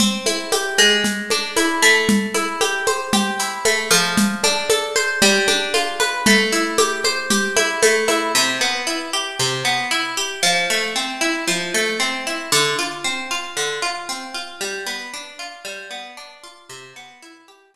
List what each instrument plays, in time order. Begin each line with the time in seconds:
0.00 acoustic guitar (steel) C4, low conga, shaker
0.26 acoustic guitar (steel) E4, high conga, shaker
0.52 acoustic guitar (steel) G4, high conga, shaker
0.78 acoustic guitar (steel) G#3, high conga, shaker
1.04 low conga, shaker
1.30 acoustic guitar (steel) D4, high conga, shaker
1.56 acoustic guitar (steel) E4, high conga, shaker
1.82 acoustic guitar (steel) A3, shaker
2.09 low conga, shaker
2.34 acoustic guitar (steel) E4, high conga, shaker
2.61 acoustic guitar (steel) G4, high conga, shaker
2.87 acoustic guitar (steel) C5, high conga, shaker
3.13 acoustic guitar (steel) G4, low conga, shaker
3.39 acoustic guitar (steel) E4, shaker
3.65 acoustic guitar (steel) A3, high conga, shaker
3.91 acoustic guitar (steel) F3, high conga, shaker
4.17 low conga, shaker
4.43 acoustic guitar (steel) D4, high conga, shaker
4.70 acoustic guitar (steel) A4, high conga, shaker
4.96 acoustic guitar (steel) C5, high conga, shaker
5.22 acoustic guitar (steel) G3, low conga, shaker
5.48 acoustic guitar (steel) D4, high conga, shaker
5.74 acoustic guitar (steel) F4, high conga, shaker
6.00 acoustic guitar (steel) B4, high conga, shaker
6.26 acoustic guitar (steel) A3, low conga, shaker
6.52 acoustic guitar (steel) E4, shaker
6.78 acoustic guitar (steel) G4, high conga, shaker
7.04 acoustic guitar (steel) C5, high conga, shaker
7.30 acoustic guitar (steel) G4, low conga, shaker
7.57 acoustic guitar (steel) E4, high conga, shaker
7.82 acoustic guitar (steel) A3, high conga, shaker
8.08 acoustic guitar (steel) E4, high conga, shaker
8.35 acoustic guitar (steel) C3
8.61 acoustic guitar (steel) B3
8.87 acoustic guitar (steel) E4
9.13 acoustic guitar (steel) G4
9.39 acoustic guitar (steel) C3
9.65 acoustic guitar (steel) B3
9.91 acoustic guitar (steel) E4
10.17 acoustic guitar (steel) G4
10.43 acoustic guitar (steel) F3
10.70 acoustic guitar (steel) A3
10.96 acoustic guitar (steel) C4
11.21 acoustic guitar (steel) E4
11.47 acoustic guitar (steel) F3
11.74 acoustic guitar (steel) A3
12.00 acoustic guitar (steel) C4
12.27 acoustic guitar (steel) E4
12.52 acoustic guitar (steel) D3
12.79 acoustic guitar (steel) F4
13.04 acoustic guitar (steel) C4
13.31 acoustic guitar (steel) F4
13.57 acoustic guitar (steel) D3
13.82 acoustic guitar (steel) F4
14.09 acoustic guitar (steel) C4
14.34 acoustic guitar (steel) F4
14.61 acoustic guitar (steel) G3
14.87 acoustic guitar (steel) B3
15.14 acoustic guitar (steel) D4
15.39 acoustic guitar (steel) F4
15.65 acoustic guitar (steel) G3
15.91 acoustic guitar (steel) B3
16.17 acoustic guitar (steel) D4
16.43 acoustic guitar (steel) F4
16.69 acoustic guitar (steel) C3
16.96 acoustic guitar (steel) B3
17.22 acoustic guitar (steel) E4
17.48 acoustic guitar (steel) G4
17.74 acoustic guitar (steel) C3